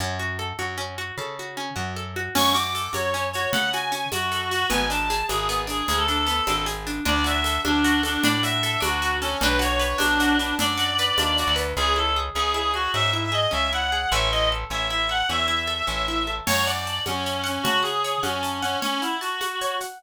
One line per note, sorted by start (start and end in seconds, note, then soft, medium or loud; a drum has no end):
0.00 0.53 F#2 medium
0.00 0.18 C#4 medium
0.19 0.37 F#4 medium
0.39 0.57 A4 medium
0.59 1.12 F#2 medium
0.59 0.76 F#4 medium
0.78 0.95 C#4 medium
0.98 1.16 F#4 medium
1.18 1.71 C#3 medium
1.18 1.36 A4 medium
1.39 1.57 F#4 medium
1.57 1.75 C#4 medium
1.76 2.29 F#2 medium
1.76 1.93 F#4 medium
1.96 2.14 A4 medium
2.16 2.34 F#4 medium
2.35 2.88 F#2 medium
2.35 2.53 C#4 loud
2.35 2.54 C#6 medium
2.35 crash loud
2.35 low conga medium
2.35 shaker medium
2.54 2.72 F#4 medium
2.54 2.89 D6 medium
2.54 shaker medium
2.75 2.92 A4 medium
2.75 shaker medium
2.93 3.47 F#2 medium
2.93 3.11 F#4 medium
2.93 3.26 C#5 medium
2.93 high conga medium
2.93 shaker medium
3.14 3.32 C#4 medium
3.14 shaker medium
3.33 3.53 F#4 medium
3.33 3.51 C#5 medium
3.33 shaker medium
3.52 4.06 C#3 medium
3.52 3.72 A4 medium
3.52 3.70 F#5 medium
3.52 low conga loud
3.52 shaker medium
3.73 3.92 F#4 medium
3.73 4.08 G#5 medium
3.73 shaker medium
3.92 4.10 C#4 medium
3.92 shaker medium
4.12 4.65 F#2 medium
4.12 4.30 F#4 medium
4.12 4.49 F#4 medium
4.12 high conga medium
4.12 shaker medium
4.31 4.49 A4 medium
4.31 shaker medium
4.51 4.67 F#4 medium
4.51 4.69 F#4 medium
4.51 shaker medium
4.70 5.23 G#1 medium
4.70 4.87 B3 loud
4.70 4.86 G#5 medium
4.70 low conga medium
4.70 shaker medium
4.90 5.08 D4 medium
4.90 5.23 A5 medium
4.90 shaker medium
5.10 5.28 G#4 medium
5.10 shaker medium
5.28 5.82 G#1 medium
5.28 5.47 D4 medium
5.28 5.61 G#4 medium
5.28 high conga medium
5.28 shaker medium
5.49 5.67 B3 medium
5.49 shaker medium
5.67 5.85 D4 medium
5.67 5.87 G#4 medium
5.67 shaker medium
5.88 6.41 D2 medium
5.88 5.97 G#4 medium
5.88 6.06 G#4 medium
5.88 low conga medium
5.88 shaker medium
5.97 6.06 A4 medium
6.08 6.26 D4 medium
6.08 6.16 A4 medium
6.08 shaker medium
6.17 6.63 A4 medium
6.27 6.44 B3 medium
6.27 shaker medium
6.47 7.00 G#1 medium
6.47 6.65 D4 medium
6.47 high conga medium
6.47 shaker medium
6.66 6.84 G#4 medium
6.66 shaker medium
6.86 7.04 D4 medium
6.86 shaker medium
7.05 7.59 D2 loud
7.05 7.64 D4 loud
7.05 7.27 D5 medium
7.05 low conga medium
7.24 7.84 F#4 medium
7.24 7.60 E5 medium
7.24 shaker medium
7.44 8.03 A4 medium
7.44 shaker medium
7.65 8.18 D2 medium
7.65 8.24 D4 medium
7.65 8.01 D4 medium
7.65 high conga medium
7.84 8.43 F#4 medium
7.84 shaker medium
8.03 8.24 D4 medium
8.03 8.63 A4 medium
8.03 shaker medium
8.24 8.77 A2 medium
8.24 8.80 D4 medium
8.24 8.40 D5 medium
8.24 low conga loud
8.24 shaker medium
8.43 9.02 F#4 medium
8.43 8.79 E5 medium
8.43 shaker medium
8.63 9.21 A4 medium
8.63 shaker medium
8.80 9.35 D2 medium
8.80 9.36 D4 medium
8.80 9.16 F#4 medium
8.80 high conga medium
8.80 shaker medium
9.02 9.39 F#4 medium
9.02 shaker medium
9.21 9.39 C#4 medium
9.21 9.40 A4 medium
9.21 shaker medium
9.41 9.94 B1 loud
9.41 9.98 D4 loud
9.41 9.59 B4 medium
9.41 low conga loud
9.41 shaker medium
9.59 10.20 F#4 medium
9.59 9.98 C#5 medium
9.59 shaker medium
9.79 10.39 B4 medium
9.79 shaker medium
9.98 10.53 B1 medium
9.98 10.37 D4 medium
9.98 10.60 D4 medium
9.98 high conga medium
9.98 shaker medium
10.20 10.77 F#4 medium
10.20 shaker medium
10.38 10.55 D4 medium
10.38 10.99 B4 medium
10.38 shaker medium
10.59 11.12 F#2 medium
10.59 11.19 D4 medium
10.59 11.56 D5 medium
10.59 low conga loud
10.59 shaker medium
10.77 11.39 F#4 medium
10.77 shaker medium
10.98 11.55 B4 medium
10.98 shaker medium
11.17 11.44 D#2 medium
11.17 11.75 D4 medium
11.17 high conga medium
11.17 shaker medium
11.37 11.76 F#4 medium
11.37 shaker medium
11.47 11.74 D2 medium
11.56 11.75 B4 medium
11.56 shaker medium
11.77 12.30 C#2 loud
11.77 11.95 C#4 medium
11.77 11.94 G#4 medium
11.96 12.14 E4 medium
11.96 12.16 A4 medium
12.16 12.34 G#4 medium
12.35 12.88 C#2 medium
12.35 12.54 C#4 medium
12.35 12.54 G#4 medium
12.54 12.72 E4 medium
12.54 12.74 G#4 medium
12.74 12.91 F#4 medium
12.74 12.91 G#4 medium
12.94 13.47 G#2 medium
12.94 13.12 C#4 medium
12.94 13.10 E5 medium
13.13 13.31 E4 medium
13.13 13.22 E5 medium
13.24 13.33 E5 medium
13.32 13.50 G#4 medium
13.32 13.51 D#5 medium
13.51 14.06 C#2 medium
13.51 13.69 C#4 medium
13.51 13.70 E5 medium
13.73 13.90 E4 medium
13.73 14.11 F#5 medium
13.92 14.10 G#4 medium
14.11 14.65 A1 loud
14.11 14.30 C#4 medium
14.11 14.28 E5 medium
14.32 14.50 E4 medium
14.32 14.48 D#5 medium
14.52 14.70 A4 medium
14.70 15.23 A1 medium
14.70 14.89 C#4 medium
14.70 14.87 E5 medium
14.90 15.08 E4 medium
14.90 15.09 E5 medium
15.09 15.27 A4 medium
15.09 15.28 F#5 medium
15.29 15.82 E2 medium
15.29 15.47 C#4 medium
15.29 16.29 E5 medium
15.48 15.66 E4 medium
15.67 15.85 A4 medium
15.87 16.41 A1 medium
15.87 16.05 C#4 medium
16.08 16.26 E4 medium
16.27 16.45 A4 medium
16.46 17.00 F#2 medium
16.46 16.65 C#5 medium
16.46 16.65 C#5 loud
16.46 crash loud
16.46 low conga loud
16.46 shaker medium
16.66 17.00 D5 medium
16.66 16.85 F#5 medium
16.66 shaker medium
16.86 17.05 A5 medium
16.86 shaker medium
17.06 17.59 F#2 medium
17.06 17.45 C#4 medium
17.06 17.25 F#5 medium
17.06 high conga medium
17.06 shaker medium
17.26 17.44 C#5 medium
17.26 shaker medium
17.44 17.63 C#4 medium
17.44 17.61 F#5 medium
17.44 shaker medium
17.63 18.18 C#3 medium
17.63 17.80 F#4 medium
17.63 17.83 A5 medium
17.63 low conga loud
17.63 shaker medium
17.83 18.20 G#4 medium
17.83 18.00 F#5 medium
17.83 shaker medium
18.04 18.22 C#5 medium
18.04 shaker medium
18.22 18.76 F#2 medium
18.22 18.59 C#4 medium
18.22 18.41 F#5 medium
18.22 high conga medium
18.22 shaker medium
18.43 18.61 A5 medium
18.43 shaker medium
18.62 18.78 C#4 medium
18.62 18.80 F#5 medium
18.62 shaker medium
18.82 19.01 C#4 medium
18.82 19.00 C#5 medium
18.82 low conga medium
18.82 shaker medium
19.01 19.17 E4 medium
19.01 19.20 F#5 medium
19.01 shaker medium
19.21 19.76 F#4 medium
19.21 19.39 A5 medium
19.21 shaker medium
19.41 19.58 F#5 medium
19.41 high conga medium
19.41 shaker medium
19.61 19.79 C#5 medium
19.61 shaker medium
19.80 19.99 F#5 medium
19.80 shaker medium